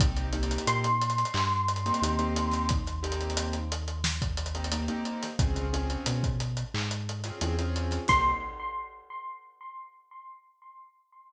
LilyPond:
<<
  \new Staff \with { instrumentName = "Electric Piano 1" } { \time 4/4 \key c \phrygian \tempo 4 = 89 r4 c'''2. | r1 | r1 | c'''4 r2. | }
  \new Staff \with { instrumentName = "Acoustic Grand Piano" } { \time 4/4 \key c \phrygian <bes c' ees' g'>8 <bes c' ees' g'>2~ <bes c' ees' g'>16 <bes c' ees' g'>16 <bes c' ees' g'>16 <bes c' ees' g'>8.~ | <bes c' ees' g'>8 <bes c' ees' g'>2~ <bes c' ees' g'>16 <bes c' ees' g'>16 <bes c' ees' g'>16 <bes c' ees' g'>8. | <c' des' f' aes'>8 <c' des' f' aes'>2~ <c' des' f' aes'>16 <c' des' f' aes'>16 <c' des' f' aes'>16 <c' des' f' aes'>8. | <bes c' ees' g'>4 r2. | }
  \new Staff \with { instrumentName = "Synth Bass 1" } { \clef bass \time 4/4 \key c \phrygian c,4 bes,4 g,4 ees,4~ | ees,1 | des,4 b,4 aes,4 e,4 | c,4 r2. | }
  \new DrumStaff \with { instrumentName = "Drums" } \drummode { \time 4/4 <hh bd>16 hh16 hh32 hh32 hh32 hh32 hh16 <hh sn>16 hh32 hh32 hh32 hh32 hc16 sn16 hh32 hh32 hh32 hh32 hh16 hh16 hh16 <hh sn>16 | <hh bd>16 <hh sn>16 hh32 hh32 hh32 hh32 hh16 hh16 hh16 hh16 sn16 <hh bd>16 hh32 hh32 hh32 hh32 hh16 hh16 hh16 <hh sn>16 | <hh bd>16 hh16 hh16 hh16 hh16 <hh bd>16 hh16 hh16 hc16 hh16 hh16 <hh sn>16 hh16 hh16 hh16 <hh sn>16 | <cymc bd>4 r4 r4 r4 | }
>>